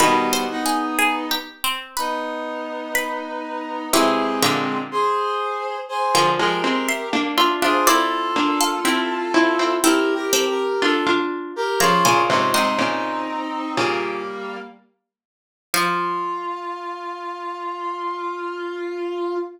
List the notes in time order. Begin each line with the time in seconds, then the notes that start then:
0.00 B2 D#3 G3 B3 B4 B5
0.33 C5 C6
0.51 B3 D#4
0.66 G#4 G#5
0.99 G#4 G#5
1.31 G4 G5
1.64 C4 C5
1.97 B3 D#4 B4 B5
2.95 B4 B5
3.93 C3 E3 G#3 C4 G4 E5
4.42 A#2 D3 G4 E5
4.91 G#4 C5
5.89 G#4 C5
6.15 D3 F3 A#4 G5
6.39 F3 G#3 G4 A#4
6.64 G#3 C4
6.89 E5 C6
7.13 A#3 D4
7.38 D4 F4 E5 C6
7.62 D4 F4 G#4 C5 E5 C6
7.87 C4 E4 F4 A4 D5
8.36 A#3 D4
8.61 A4 F5
8.85 C4 E4 G4 E5
9.34 C4 E4
9.59 C4 E4
9.83 C4 E4 G4 A4 A#4
10.15 G4 A#4
10.33 C4 A4
10.49 G4 A#4
10.82 D4 F4 A4
11.07 D4 F4
11.56 G4 A#4
11.80 C#3 F3 C#4 F4 C#5 A#5
12.05 A#2 C#3 C5 G#5
12.28 G#2 C3 C#4 F4
12.53 G#2 C3 C4 D#4 D#5 C6
12.78 A#2 C#3
13.77 A#2 C#3 G3 A#3
15.74 F3 F4 F5